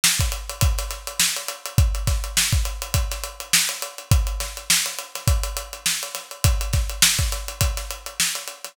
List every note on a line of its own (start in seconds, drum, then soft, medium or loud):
0.04 snare loud
0.20 kick medium
0.20 closed hi-hat medium
0.32 closed hi-hat medium
0.50 closed hi-hat medium
0.61 kick loud
0.61 closed hi-hat loud
0.78 snare soft
0.78 closed hi-hat medium
0.91 snare soft
0.91 closed hi-hat medium
1.07 closed hi-hat medium
1.20 snare loud
1.36 closed hi-hat medium
1.48 closed hi-hat medium
1.66 closed hi-hat medium
1.78 kick loud
1.78 closed hi-hat medium
1.95 closed hi-hat medium
2.07 kick medium
2.07 snare medium
2.07 closed hi-hat medium
2.24 closed hi-hat medium
2.37 snare loud
2.53 kick medium
2.53 closed hi-hat medium
2.65 closed hi-hat medium
2.82 closed hi-hat medium
2.94 kick medium
2.94 closed hi-hat loud
3.11 snare soft
3.11 closed hi-hat medium
3.24 closed hi-hat medium
3.40 closed hi-hat medium
3.53 snare loud
3.69 closed hi-hat medium
3.82 closed hi-hat medium
3.98 closed hi-hat medium
4.11 kick loud
4.11 closed hi-hat loud
4.27 closed hi-hat medium
4.40 snare medium
4.40 closed hi-hat medium
4.57 closed hi-hat medium
4.70 snare loud
4.86 snare soft
4.86 closed hi-hat medium
4.99 closed hi-hat medium
5.15 snare soft
5.15 closed hi-hat medium
5.28 kick loud
5.28 closed hi-hat loud
5.43 closed hi-hat medium
5.57 closed hi-hat medium
5.73 closed hi-hat medium
5.86 snare loud
6.03 closed hi-hat medium
6.15 snare soft
6.15 closed hi-hat medium
6.31 closed hi-hat medium
6.44 kick loud
6.44 closed hi-hat loud
6.61 closed hi-hat medium
6.73 kick medium
6.73 snare medium
6.73 closed hi-hat medium
6.90 closed hi-hat medium
7.02 snare loud
7.19 kick medium
7.19 closed hi-hat medium
7.32 snare soft
7.32 closed hi-hat medium
7.48 closed hi-hat medium
7.61 kick medium
7.61 closed hi-hat loud
7.77 snare soft
7.77 closed hi-hat medium
7.91 closed hi-hat medium
8.06 closed hi-hat medium
8.20 snare loud
8.35 closed hi-hat medium
8.48 closed hi-hat medium
8.64 snare soft
8.64 closed hi-hat medium